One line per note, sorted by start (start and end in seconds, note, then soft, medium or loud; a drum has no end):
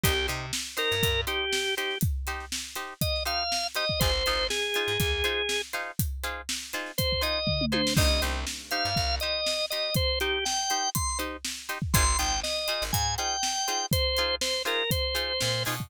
0.04 0.28 C2 loud
0.04 0.13 D#4 loud
0.04 0.27 G4 loud
0.04 0.13 G4 loud
0.04 0.13 C5 loud
0.04 kick medium
0.04 closed hi-hat loud
0.28 0.52 C3 medium
0.28 0.46 D#4 medium
0.28 0.46 G4 medium
0.28 0.46 C5 medium
0.28 closed hi-hat medium
0.53 snare loud
0.77 0.95 D#4 medium
0.77 0.95 G4 medium
0.77 1.21 A#4 loud
0.77 0.95 C5 medium
0.77 snare soft
0.77 closed hi-hat medium
0.92 1.02 G2 medium
0.92 closed hi-hat soft
1.03 1.25 G2 medium
1.03 kick medium
1.03 closed hi-hat medium
1.27 1.45 D#4 medium
1.27 1.45 G4 medium
1.27 1.75 G4 medium
1.27 1.45 C5 loud
1.27 closed hi-hat medium
1.53 snare loud
1.77 1.95 D#4 medium
1.77 1.95 G4 medium
1.77 1.98 G4 medium
1.77 1.95 C5 medium
1.77 closed hi-hat medium
1.91 snare soft
2.01 kick loud
2.01 closed hi-hat medium
2.27 2.45 D#4 medium
2.27 2.45 G4 medium
2.27 2.45 C5 medium
2.27 snare soft
2.27 closed hi-hat medium
2.40 snare soft
2.52 snare loud
2.76 2.94 D#4 medium
2.76 2.94 G4 medium
2.76 2.94 C5 medium
2.76 closed hi-hat medium
3.01 3.23 D#5 medium
3.01 kick medium
3.01 closed hi-hat medium
3.16 snare soft
3.25 3.44 D#4 medium
3.25 3.44 G4 medium
3.25 3.44 C5 medium
3.25 3.67 F5 medium
3.25 closed hi-hat medium
3.52 snare medium
3.75 3.85 D#4 medium
3.75 3.85 G4 medium
3.75 3.85 C5 medium
3.75 4.00 D#5 medium
3.75 snare soft
3.75 closed hi-hat medium
3.89 kick medium
4.00 4.23 G#1 medium
4.00 4.11 D#4 loud
4.00 4.11 F4 medium
4.00 4.11 G#4 medium
4.00 4.47 C5 medium
4.00 4.11 C5 medium
4.00 kick medium
4.00 closed hi-hat medium
4.26 4.49 G#1 medium
4.26 4.44 D#4 loud
4.26 4.44 F4 medium
4.26 4.44 G#4 medium
4.26 4.44 C5 medium
4.26 closed hi-hat medium
4.50 5.62 G#4 medium
4.50 snare loud
4.74 4.93 D#4 medium
4.74 4.93 F4 medium
4.74 4.93 G#4 medium
4.74 4.93 C5 medium
4.74 closed hi-hat medium
4.88 4.98 G#2 medium
5.00 5.22 D#2 medium
5.00 kick medium
5.00 closed hi-hat medium
5.24 5.42 D#4 medium
5.24 5.42 F4 medium
5.24 5.42 G#4 loud
5.24 5.42 C5 medium
5.24 closed hi-hat medium
5.49 snare loud
5.73 5.91 D#4 medium
5.73 5.91 F4 medium
5.73 5.91 G#4 medium
5.73 5.91 C5 medium
5.73 closed hi-hat medium
5.99 kick medium
5.99 closed hi-hat loud
6.24 6.42 D#4 medium
6.24 6.42 F4 medium
6.24 6.42 G#4 medium
6.24 6.42 C5 medium
6.24 closed hi-hat medium
6.49 snare loud
6.62 snare soft
6.73 6.92 D#4 medium
6.73 6.92 F4 medium
6.73 6.92 G#4 medium
6.73 6.92 C5 medium
6.73 closed hi-hat medium
6.86 snare soft
6.98 7.22 C5 loud
6.98 kick medium
6.98 closed hi-hat loud
7.12 kick medium
7.21 7.39 D#4 medium
7.21 7.39 F4 medium
7.21 7.39 G#4 medium
7.21 7.39 C5 medium
7.21 7.65 D#5 medium
7.21 closed hi-hat medium
7.47 kick medium
7.47 floor tom medium
7.61 mid tom medium
7.72 7.82 D#4 medium
7.72 7.82 F4 medium
7.72 7.82 G#4 medium
7.72 7.82 C5 medium
7.72 7.94 C5 medium
7.72 high tom medium
7.87 snare loud
7.97 8.20 C2 medium
7.97 8.06 D#4 loud
7.97 8.06 G4 medium
7.97 8.06 C5 loud
7.97 8.22 D#5 loud
7.97 kick loud
7.97 crash loud
8.22 8.45 C2 medium
8.22 8.40 D#4 medium
8.22 8.40 G4 medium
8.22 8.40 C5 medium
8.22 closed hi-hat medium
8.47 snare medium
8.71 8.90 D#4 medium
8.71 8.90 G4 medium
8.71 8.90 C5 medium
8.71 9.15 F5 medium
8.71 closed hi-hat medium
8.85 8.95 G2 medium
8.96 9.19 C2 medium
8.96 kick medium
9.20 9.40 D#4 medium
9.20 9.40 G4 medium
9.20 9.40 C5 medium
9.20 9.66 D#5 medium
9.20 closed hi-hat medium
9.46 snare medium
9.70 9.90 D#4 medium
9.70 9.90 G4 medium
9.70 9.90 C5 medium
9.70 9.94 D#5 medium
9.70 snare soft
9.70 closed hi-hat medium
9.95 10.19 C5 loud
9.95 kick medium
9.95 closed hi-hat medium
10.20 10.39 D#4 medium
10.20 10.45 G4 medium
10.20 10.39 G4 medium
10.20 10.39 C5 medium
10.20 closed hi-hat medium
10.45 10.90 G5 medium
10.45 snare medium
10.70 10.89 D#4 medium
10.70 10.89 G4 medium
10.70 10.89 C5 medium
10.70 closed hi-hat medium
10.95 11.18 C6 medium
10.95 kick medium
10.95 closed hi-hat loud
11.09 snare soft
11.19 11.37 D#4 medium
11.19 11.37 G4 medium
11.19 11.37 C5 medium
11.19 closed hi-hat medium
11.45 snare loud
11.69 11.78 D#4 medium
11.69 11.78 G4 medium
11.69 11.78 C5 medium
11.69 closed hi-hat medium
11.82 kick medium
11.94 12.16 G#1 loud
11.94 12.04 D#4 medium
11.94 12.04 F4 medium
11.94 12.04 G#4 loud
11.94 12.04 C5 loud
11.94 12.18 C6 loud
11.94 kick loud
11.94 closed hi-hat loud
12.18 12.42 G#1 medium
12.18 12.36 D#4 medium
12.18 12.36 F4 medium
12.18 12.36 G#4 medium
12.18 12.36 C5 medium
12.18 12.40 G5 medium
12.18 closed hi-hat medium
12.43 12.84 D#5 medium
12.43 snare medium
12.57 snare soft
12.68 12.86 D#4 medium
12.68 12.86 F4 medium
12.68 12.86 G#4 medium
12.68 12.86 C5 medium
12.68 closed hi-hat medium
12.82 12.92 G#1 medium
12.93 13.16 G#2 medium
12.93 13.15 G#5 medium
12.93 kick medium
12.93 closed hi-hat loud
13.18 13.36 D#4 medium
13.18 13.36 F4 medium
13.18 13.36 G#4 medium
13.18 13.36 C5 medium
13.18 13.86 G5 medium
13.18 closed hi-hat medium
13.43 snare loud
13.68 13.86 D#4 medium
13.68 13.86 F4 medium
13.68 13.86 G#4 medium
13.68 13.86 C5 medium
13.68 closed hi-hat medium
13.92 14.35 C5 loud
13.92 kick loud
13.92 closed hi-hat loud
14.17 14.36 D#4 medium
14.17 14.36 F4 medium
14.17 14.36 G#4 medium
14.17 14.36 C5 medium
14.17 closed hi-hat medium
14.41 14.63 C5 medium
14.41 snare loud
14.65 14.83 D#4 medium
14.65 14.83 F4 medium
14.65 14.83 G#4 medium
14.65 14.90 A#4 medium
14.65 14.83 C5 medium
14.65 closed hi-hat medium
14.91 15.63 C5 medium
14.91 kick medium
14.91 closed hi-hat loud
15.15 15.33 D#4 medium
15.15 15.33 F4 medium
15.15 15.33 G#4 medium
15.15 15.33 C5 medium
15.15 closed hi-hat medium
15.41 15.65 A#2 loud
15.41 snare loud
15.65 15.90 B2 medium
15.65 15.75 D#4 medium
15.65 15.75 F4 medium
15.65 15.75 G#4 medium
15.65 15.75 C5 medium
15.65 open hi-hat medium
15.80 kick medium